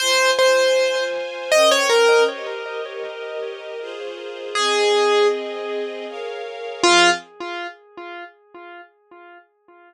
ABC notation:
X:1
M:3/4
L:1/16
Q:1/4=79
K:Fm
V:1 name="Acoustic Grand Piano"
c2 c4 z2 e d B2 | z12 | A4 z8 | F4 z8 |]
V:2 name="String Ensemble 1"
[Fca]8 [DBg]4 | [GBe]8 [FAc]4 | [CAe]8 [Bdf]4 | [F,CA]4 z8 |]